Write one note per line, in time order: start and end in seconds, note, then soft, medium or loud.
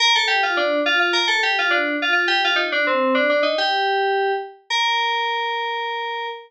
0.00 0.13 A#4 loud
0.15 0.29 A4 loud
0.28 0.41 G4 medium
0.43 0.57 F4 medium
0.57 0.80 D4 loud
0.86 0.99 F4 loud
1.00 1.13 F4 medium
1.13 1.27 A#4 loud
1.28 1.41 A4 loud
1.43 1.56 G4 loud
1.59 1.72 F4 loud
1.70 1.96 D4 medium
2.02 2.12 F4 medium
2.13 2.26 F4 medium
2.28 2.41 G4 loud
2.44 2.58 F4 loud
2.56 2.69 D#4 loud
2.72 2.86 D4 loud
2.87 3.15 C4 medium
3.15 3.28 D4 medium
3.29 3.43 D4 medium
3.43 3.56 D#4 loud
3.58 4.32 G4 loud
4.70 6.27 A#4 loud